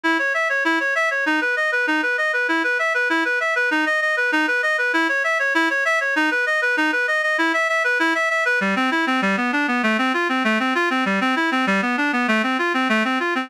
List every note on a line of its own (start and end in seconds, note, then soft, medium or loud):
0.04 0.18 E4 medium
0.19 0.33 C#5 medium
0.34 0.48 E5 medium
0.49 0.64 C#5 medium
0.65 0.79 E4 medium
0.80 0.94 C#5 medium
0.95 1.09 E5 medium
1.11 1.25 C#5 medium
1.26 1.40 D#4 medium
1.41 1.55 B4 medium
1.57 1.71 D#5 medium
1.72 1.86 B4 medium
1.87 2.01 D#4 medium
2.03 2.17 B4 medium
2.18 2.32 D#5 medium
2.33 2.47 B4 medium
2.48 2.63 E4 medium
2.64 2.78 B4 medium
2.79 2.93 E5 medium
2.94 3.08 B4 medium
3.10 3.24 E4 medium
3.25 3.39 B4 medium
3.40 3.54 E5 medium
3.56 3.70 B4 medium
3.71 3.85 D#4 medium
3.86 4.00 D#5 medium
4.02 4.16 D#5 medium
4.17 4.31 B4 medium
4.32 4.46 D#4 medium
4.47 4.61 B4 medium
4.63 4.77 D#5 medium
4.78 4.92 B4 medium
4.93 5.08 E4 medium
5.09 5.23 C#5 medium
5.24 5.38 E5 medium
5.39 5.53 C#5 medium
5.55 5.69 E4 medium
5.70 5.84 C#5 medium
5.85 5.99 E5 medium
6.01 6.15 C#5 medium
6.16 6.30 D#4 medium
6.31 6.45 B4 medium
6.46 6.61 D#5 medium
6.62 6.76 B4 medium
6.77 6.91 D#4 medium
6.92 7.07 B4 medium
7.08 7.22 D#5 medium
7.23 7.37 D#5 medium
7.38 7.52 E4 medium
7.54 7.68 E5 medium
7.69 7.83 E5 medium
7.84 7.98 B4 medium
7.99 8.14 E4 medium
8.15 8.29 E5 medium
8.30 8.44 E5 medium
8.45 8.59 B4 medium
8.61 8.75 G3 medium
8.76 8.90 C4 medium
8.91 9.05 E4 medium
9.07 9.21 C4 medium
9.22 9.36 G3 medium
9.37 9.51 B3 medium
9.53 9.67 D4 medium
9.68 9.82 B3 medium
9.83 9.97 A3 medium
9.98 10.13 C4 medium
10.14 10.28 F4 medium
10.29 10.43 C4 medium
10.44 10.58 A3 medium
10.60 10.74 C4 medium
10.75 10.89 F4 medium
10.90 11.04 C4 medium
11.06 11.20 G3 medium
11.21 11.35 C4 medium
11.36 11.50 E4 medium
11.52 11.66 C4 medium
11.67 11.81 G3 medium
11.82 11.96 B3 medium
11.97 12.11 D4 medium
12.13 12.27 B3 medium
12.28 12.42 A3 medium
12.43 12.57 C4 medium
12.59 12.73 F4 medium
12.74 12.88 C4 medium
12.89 13.03 A3 medium
13.05 13.19 C4 medium
13.20 13.34 F4 medium
13.35 13.49 C4 medium